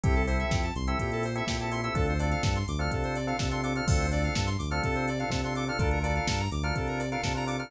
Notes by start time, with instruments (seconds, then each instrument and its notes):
0.04 synth bass 1 C2, drawbar organ C4 E4 G4 A4, lead 1 (square) G4, kick, closed hi-hat
0.15 lead 1 (square) A4, closed hi-hat
0.27 drawbar organ C4 E4 G4 A4, lead 1 (square) C5, open hi-hat
0.39 lead 1 (square) E5, closed hi-hat
0.50 synth bass 1 F2, lead 1 (square) G5, kick, snare
0.63 lead 1 (square) A5, closed hi-hat
0.75 synth bass 1 C2, lead 1 (square) C6, open hi-hat
0.87 drawbar organ C4 E4 G4 A4, lead 1 (square) E6, closed hi-hat
0.99 synth bass 1 A#2, lead 1 (square) G4, kick, closed hi-hat
1.12 lead 1 (square) A4, closed hi-hat
1.23 lead 1 (square) C5, open hi-hat
1.35 drawbar organ C4 E4 G4 A4, lead 1 (square) E5, closed hi-hat
1.47 synth bass 1 A#2, drawbar organ C4 E4 G4 A4, lead 1 (square) G5, kick, snare
1.60 drawbar organ C4 E4 G4 A4, lead 1 (square) A5, closed hi-hat
1.71 drawbar organ C4 E4 G4 A4, lead 1 (square) C6, open hi-hat
1.83 drawbar organ C4 E4 G4 A4, lead 1 (square) E6, closed hi-hat
1.95 synth bass 1 D2, drawbar organ C4 D4 F4 A4, lead 1 (square) A4, kick, closed hi-hat
2.07 lead 1 (square) C5, closed hi-hat
2.19 drawbar organ C4 D4 F4 A4, lead 1 (square) D5, open hi-hat
2.31 lead 1 (square) F5, closed hi-hat
2.43 synth bass 1 G2, lead 1 (square) A5, kick, snare
2.56 lead 1 (square) C6, closed hi-hat
2.68 synth bass 1 D2, lead 1 (square) D6, open hi-hat
2.79 drawbar organ C4 D4 F4 A4, lead 1 (square) F6, closed hi-hat
2.91 synth bass 1 C3, lead 1 (square) A4, kick, closed hi-hat
3.04 lead 1 (square) C5, closed hi-hat
3.15 lead 1 (square) D5, open hi-hat
3.27 drawbar organ C4 D4 F4 A4, lead 1 (square) F5, closed hi-hat
3.39 synth bass 1 C3, drawbar organ C4 D4 F4 A4, lead 1 (square) A5, kick, snare
3.51 drawbar organ C4 D4 F4 A4, lead 1 (square) C6, closed hi-hat
3.63 drawbar organ C4 D4 F4 A4, lead 1 (square) D6, open hi-hat
3.75 drawbar organ C4 D4 F4 A4, lead 1 (square) F6, closed hi-hat
3.88 synth bass 1 D2, drawbar organ C4 D4 F4 A4, lead 1 (square) A4, kick, crash
3.99 lead 1 (square) C5, closed hi-hat
4.11 drawbar organ C4 D4 F4 A4, lead 1 (square) D5, open hi-hat
4.24 lead 1 (square) F5, closed hi-hat
4.34 synth bass 1 G2, lead 1 (square) A5, kick, snare
4.46 lead 1 (square) C6, closed hi-hat
4.59 synth bass 1 D2, lead 1 (square) D6, open hi-hat
4.70 drawbar organ C4 D4 F4 A4, lead 1 (square) F6, closed hi-hat
4.83 synth bass 1 C3, lead 1 (square) A4, kick, closed hi-hat
4.95 lead 1 (square) C5, closed hi-hat
5.08 lead 1 (square) D5, open hi-hat
5.19 drawbar organ C4 D4 F4 A4, lead 1 (square) F5, closed hi-hat
5.30 synth bass 1 C3, drawbar organ C4 D4 F4 A4, lead 1 (square) A5, kick, snare
5.44 drawbar organ C4 D4 F4 A4, lead 1 (square) C6, closed hi-hat
5.55 drawbar organ C4 D4 F4 A4, lead 1 (square) D6, open hi-hat
5.67 drawbar organ C4 D4 F4 A4, lead 1 (square) F6, closed hi-hat
5.79 synth bass 1 D2, drawbar organ D4 F4 A4 A#4, lead 1 (square) A4, kick, closed hi-hat
5.91 lead 1 (square) A#4, closed hi-hat
6.03 drawbar organ D4 F4 A4 A#4, lead 1 (square) D5, open hi-hat
6.15 lead 1 (square) F5, closed hi-hat
6.28 synth bass 1 G2, lead 1 (square) A5, kick, snare
6.39 lead 1 (square) A#5, closed hi-hat
6.52 synth bass 1 D2, lead 1 (square) D6, open hi-hat
6.63 drawbar organ D4 F4 A4 A#4, lead 1 (square) F6, closed hi-hat
6.75 synth bass 1 C3, lead 1 (square) A4, kick, closed hi-hat
6.88 lead 1 (square) A#4, closed hi-hat
6.99 lead 1 (square) D5, open hi-hat
7.11 drawbar organ D4 F4 A4 A#4, lead 1 (square) F5, closed hi-hat
7.23 synth bass 1 C3, drawbar organ D4 F4 A4 A#4, lead 1 (square) A5, kick, snare
7.35 drawbar organ D4 F4 A4 A#4, lead 1 (square) A#5, closed hi-hat
7.47 drawbar organ D4 F4 A4 A#4, lead 1 (square) D6, open hi-hat
7.58 drawbar organ D4 F4 A4 A#4, lead 1 (square) F6, closed hi-hat